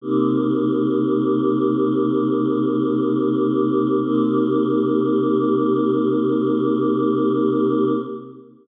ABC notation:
X:1
M:12/8
L:1/8
Q:3/8=60
K:Cm
V:1 name="Choir Aahs"
[C,B,EG]12 | [C,B,EG]12 |]